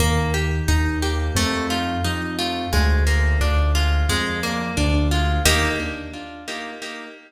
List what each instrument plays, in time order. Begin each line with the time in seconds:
0.00 acoustic grand piano D#2, orchestral harp A#3
0.34 orchestral harp G4
0.68 acoustic grand piano D#2, orchestral harp D#4
1.02 orchestral harp G4
1.35 acoustic grand piano F2, orchestral harp A3
1.70 orchestral harp F4
2.04 acoustic grand piano F2, orchestral harp D#4
2.39 orchestral harp F4
2.73 acoustic grand piano D2, orchestral harp G#3
3.07 orchestral harp A#3
3.41 acoustic grand piano D2, orchestral harp D4
3.75 orchestral harp F4
4.09 acoustic grand piano F2, orchestral harp G#3
4.43 orchestral harp A#3
4.77 acoustic grand piano D2, orchestral harp D4
5.11 orchestral harp F4
5.45 acoustic grand piano D#2, orchestral harp A#3 D#4 G4